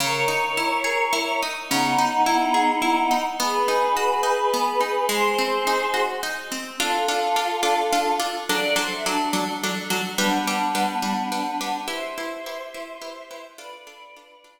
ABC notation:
X:1
M:3/4
L:1/16
Q:1/4=106
K:C#dor
V:1 name="Choir Aahs"
[Ac]12 | [B,D]12 | [GB]12 | [G^B]8 z4 |
[K:Ddor] [FA]12 | d2 c e D4 z4 | [B,D]12 | [ce]12 |
[Bd]8 z4 |]
V:2 name="Orchestral Harp"
C,2 D2 E2 G2 E2 D2 | C,2 D2 E2 G2 E2 D2 | B,2 D2 F2 D2 B,2 D2 | G,2 ^B,2 D2 F2 D2 B,2 |
[K:Ddor] [DFA]2 [DFA]2 [DFA]2 [DFA]2 [DFA]2 [DFA]2 | [^F,DA]2 [F,DA]2 [F,DA]2 [F,DA]2 [F,DA]2 [F,DA]2 | [G,DB]2 [G,DB]2 [G,DB]2 [G,DB]2 [G,DB]2 [G,DB]2 | [EGB]2 [EGB]2 [EGB]2 [EGB]2 [EGB]2 [EGB]2 |
[DFA]2 [DFA]2 [DFA]2 [DFA]2 z4 |]